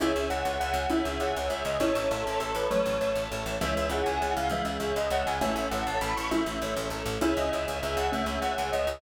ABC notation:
X:1
M:6/8
L:1/16
Q:3/8=133
K:C#m
V:1 name="Tubular Bells"
e4 f4 f4 | e4 f2 z2 e2 d2 | c4 A2 A2 A2 B2 | c6 z6 |
e4 f2 g2 f2 =f2 | e2 e2 e2 d2 f2 g2 | e4 f2 a2 b2 c'2 | e6 z6 |
e2 d2 e2 z2 e2 f2 | e4 f4 d4 |]
V:2 name="Xylophone"
[CE]12 | [CE]6 z6 | [CE]12 | [F,A,]8 z4 |
[E,G,]12 | [E,G,]12 | [A,C]12 | [CE]6 z6 |
[CE]12 | [A,C]12 |]
V:3 name="Acoustic Grand Piano"
[Gce]4 [Gce]3 [Gce] [Gce]4- | [Gce]4 [Gce]3 [Gce] [Gce]4 | [Ace]4 [Ace]3 [Ace] [Ace]4- | [Ace]4 [Ace]3 [Ace] [Ace]4 |
[Gce]4 [Gce]3 [Gce] [Gce]4- | [Gce]4 [Gce]3 [Gce] [Gce]4 | [Ace]4 [Ace]3 [Ace] [Ace]4- | [Ace]4 [Ace]3 [Ace] [Ace]4 |
[Gce]4 [Gce]3 [Gce] [Gce]4- | [Gce]4 [Gce]3 [Gce] [Gce]4 |]
V:4 name="Electric Bass (finger)" clef=bass
C,,2 C,,2 C,,2 C,,2 C,,2 C,,2 | C,,2 C,,2 C,,2 C,,2 C,,2 C,,2 | A,,,2 A,,,2 A,,,2 A,,,2 A,,,2 A,,,2 | A,,,2 A,,,2 A,,,2 A,,,2 A,,,2 A,,,2 |
C,,2 C,,2 C,,2 C,,2 C,,2 C,,2 | C,,2 C,,2 C,,2 C,,2 C,,2 C,,2 | A,,,2 A,,,2 A,,,2 A,,,2 A,,,2 A,,,2 | A,,,2 A,,,2 A,,,2 A,,,2 A,,,2 A,,,2 |
C,,2 C,,2 C,,2 C,,2 C,,2 C,,2 | C,,2 C,,2 C,,2 C,,2 C,,2 C,,2 |]
V:5 name="String Ensemble 1"
[ceg]12 | [Gcg]12 | [cea]12 | [Aca]12 |
[CEG]12 | [G,CG]12 | [CEA]12 | [A,CA]12 |
[ceg]12 | [Gcg]12 |]